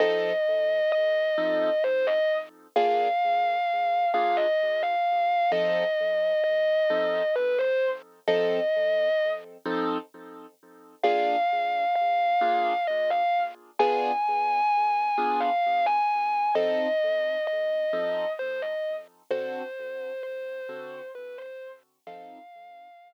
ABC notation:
X:1
M:12/8
L:1/8
Q:3/8=87
K:F
V:1 name="Distortion Guitar"
_e4 e4 c e z2 | f6 f _e2 f3 | _e4 e4 =B c z2 | _e5 z7 |
f4 f4 _e f z2 | _a6 a f2 a3 | _e4 e4 c e z2 | c4 c4 =B c z2 |
f5 z7 |]
V:2 name="Acoustic Grand Piano"
[F,C_EA]6 [F,CEA]6 | [B,DF_A]6 [B,DFA]6 | [F,C_EA]6 [F,CEA]6 | [F,C_EA]6 [F,CEA]6 |
[B,DF_A]6 [B,DFA]6 | [=B,DF_A]6 [B,DFA]6 | [F,C_EA]6 [F,CEA]6 | [D,C^FA]6 [D,CFA]6 |
[F,C_EA]6 z6 |]